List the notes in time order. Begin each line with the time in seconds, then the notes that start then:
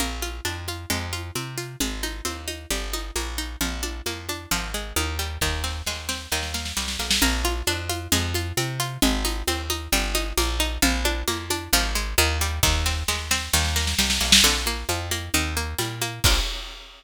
0.00 A#1 A#3, low conga, shaker
0.22 F4, high conga, shaker
0.45 F2 D4, high conga, shaker
0.68 F4, high conga, shaker
0.90 F2 G#3, low conga, shaker
1.13 F4, high conga, shaker
1.35 C3 C4, high conga, shaker
1.58 F4, shaker
1.80 G#1 G#3, low conga, shaker
2.03 D#4, high conga, shaker
2.25 D#2 C4, high conga, shaker
2.48 D#4, high conga, shaker
2.70 G1 G3, low conga, shaker
2.93 D#4, high conga, shaker
3.16 A#1 A#3, high conga, shaker
3.38 D#4, shaker
3.61 A#1 F3, low conga, shaker
3.83 D4, high conga, shaker
4.06 F2 A#3, high conga, shaker
4.29 D4, high conga, shaker
4.51 G#1 F3, low conga, shaker
4.74 G#3, shaker
4.96 D#2 D#3, high conga, shaker
5.19 G3, shaker
5.41 D#2 D#3, kick, snare
5.64 C4, snare
5.86 D#2 G#3, snare
6.09 C4, snare
6.32 D#2 D#3, snare
6.43 snare
6.54 A#3, snare
6.65 snare
6.77 C2 G3, snare
6.88 snare
6.99 B1 A#3, snare
7.11 snare
7.22 A#1 A#3, low conga, shaker
7.44 F4, high conga, shaker
7.67 F2 D4, high conga, shaker
7.89 F4, high conga, shaker
8.12 F2 G#3, low conga, shaker
8.34 F4, high conga, shaker
8.57 C3 C4, high conga, shaker
8.80 F4, shaker
9.02 G#1 G#3, low conga, shaker
9.25 D#4, high conga, shaker
9.47 D#2 C4, high conga, shaker
9.70 D#4, high conga, shaker
9.92 G1 G3, low conga, shaker
10.15 D#4, high conga, shaker
10.37 A#1 A#3, high conga, shaker
10.60 D#4, shaker
10.82 A#1 F3, low conga, shaker
11.05 D4, high conga, shaker
11.28 F2 A#3, high conga, shaker
11.50 D4, high conga, shaker
11.73 G#1 F3, low conga, shaker
11.95 G#3, shaker
12.18 D#2 D#3, high conga, shaker
12.41 G3, shaker
12.63 D#2 D#3, kick, snare
12.86 C4, snare
13.08 D#2 G#3, snare
13.31 C4, snare
13.53 D#2 D#3, snare
13.65 snare
13.76 A#3, snare
13.87 snare
13.98 C2 G3, snare
14.10 snare
14.21 B1 A#3, snare
14.32 snare
14.44 A#1 D3, low conga, shaker
14.66 A#3, high conga, shaker
14.89 F2 F3, high conga, shaker
15.11 A#3, high conga, shaker
15.34 D#2 D#3, low conga, shaker
15.56 A#3, shaker
15.78 A#2 G3, high conga, shaker
16.02 A#3, high conga, shaker
16.24 A#1 A#3 D4 F4, kick, crash